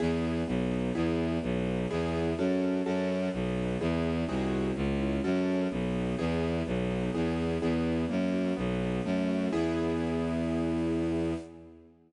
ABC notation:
X:1
M:4/4
L:1/8
Q:1/4=126
K:E
V:1 name="Acoustic Grand Piano"
[B,EG]2 B, D [B,EG]2 B, D | [B,EG]2 [CFA]2 [CFA]2 B, D | [B,EG]2 [^B,DFG]2 C E [CFA]2 | B, D [B,EG]2 B, D [B,EG]2 |
[B,EG]2 ^A, F B, D =A, F | [B,EG]8 |]
V:2 name="Violin" clef=bass
E,,2 B,,,2 E,,2 B,,,2 | E,,2 F,,2 F,,2 B,,,2 | E,,2 ^B,,,2 C,,2 F,,2 | B,,,2 E,,2 B,,,2 E,,2 |
E,,2 F,,2 B,,,2 F,,2 | E,,8 |]